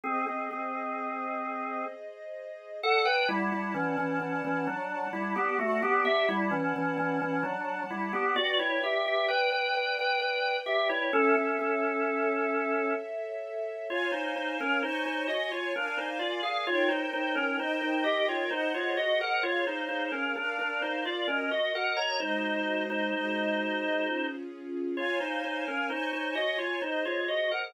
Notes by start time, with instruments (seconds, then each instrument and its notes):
0.04 drawbar organ C4 G#4, string ensemble 1 G#4 C5 D#5
0.27 drawbar organ C4 G#4
0.51 drawbar organ C4 G#4
2.82 drawbar organ A4 F#5, string ensemble 1 D5 F#5 A5
3.05 drawbar organ B4 G5
3.28 drawbar organ G3 E4
3.52 drawbar organ G3 E4
3.74 drawbar organ E3 C#4
3.98 drawbar organ E3 C#4
4.20 drawbar organ E3 C#4
4.44 drawbar organ E3 C#4
4.67 drawbar organ F#3 D4
5.13 drawbar organ G3 E4
5.36 drawbar organ B3 G4
5.59 drawbar organ A3 F#4, string ensemble 1 D5 F#5 A5
5.83 drawbar organ B3 G4
6.05 drawbar organ G4 E5
6.29 drawbar organ G3 E4
6.51 drawbar organ E3 C#4
6.76 drawbar organ E3 C#4
6.98 drawbar organ E3 C#4
7.22 drawbar organ E3 C#4
7.43 drawbar organ F#3 D4
7.90 drawbar organ G3 E4
8.13 drawbar organ B3 G4
8.36 drawbar organ F#4 D5, string ensemble 1 B4 D5 G5
8.59 drawbar organ E4 C#5
8.83 drawbar organ G4 E5
9.06 drawbar organ G4 E5
9.28 drawbar organ B4 G5
9.52 drawbar organ B4 G5
9.74 drawbar organ B4 G5
9.99 drawbar organ B4 G5
10.19 drawbar organ B4 G5
10.66 drawbar organ G4 E5
10.89 drawbar organ E4 C#5
11.13 drawbar organ C#4 A4, string ensemble 1 A4 C#5 E5
11.35 drawbar organ C#4 A4
11.59 drawbar organ C#4 A4
13.89 drawbar organ F4 C#5, string ensemble 1 C#5 F5 G#5
14.12 drawbar organ D#4 C5
14.36 drawbar organ D#4 C5
14.60 drawbar organ C#4 A#4
14.82 drawbar organ D#4 C5, string ensemble 1 C#5 G#5 C#6
15.06 drawbar organ D#4 C5
15.28 drawbar organ F#4 D#5
15.51 drawbar organ F4 C#5
15.74 drawbar organ D4 A#4, string ensemble 1 A#4 D5 F5 G#5
15.97 drawbar organ D#4 C5
16.19 drawbar organ F4 D5
16.43 drawbar organ G#4 F5
16.67 string ensemble 1 D#4 A#4 C#5 G5, drawbar organ F4 C#5
16.88 drawbar organ D#4 C5
17.13 drawbar organ D#4 C5
17.35 drawbar organ C#4 A#4
17.59 string ensemble 1 D#4 A#4 D#5 G5, drawbar organ D#4 C5
17.82 drawbar organ D#4 C5
18.04 drawbar organ G4 D#5
18.29 drawbar organ F4 C#5
18.51 drawbar organ D#4 C5, string ensemble 1 G#4 C5 D#5 F#5
18.74 drawbar organ F4 C#5
18.97 drawbar organ F#4 D#5
19.21 drawbar organ A#4 F#5
19.43 drawbar organ F4 C#5, string ensemble 1 G#4 C#5 F5
19.67 drawbar organ D#4 C5
19.89 drawbar organ D#4 C5
20.12 drawbar organ C#4 A#4
20.36 drawbar organ D4 A#4, string ensemble 1 A#4 D5 F5
20.59 drawbar organ D4 A#4
20.82 drawbar organ D#4 C5
21.05 drawbar organ F4 D5
21.28 drawbar organ C#4 A#4, string ensemble 1 F#4 A#4 D#5
21.51 drawbar organ F#4 D#5
21.75 drawbar organ A#4 F#5
21.97 drawbar organ C#5 A#5
22.20 string ensemble 1 G#3 F#4 C5 D#5, drawbar organ D#4 C5
22.90 drawbar organ D#4 C5
23.13 string ensemble 1 G#3 F#4 G#4 D#5
24.05 string ensemble 1 C#4 F4 G#4
24.97 drawbar organ F4 C#5, string ensemble 1 C#5 F5 G#5
25.20 drawbar organ D#4 C5
25.44 drawbar organ D#4 C5
25.68 drawbar organ C#4 A#4
25.90 drawbar organ D#4 C5, string ensemble 1 C#5 G#5 C#6
26.13 drawbar organ D#4 C5
26.35 drawbar organ F#4 D#5
26.58 drawbar organ F4 C#5
26.82 drawbar organ D#4 C5, string ensemble 1 G#4 C5 D#5
27.05 drawbar organ F4 C#5
27.28 drawbar organ F#4 D#5
27.51 drawbar organ A#4 F#5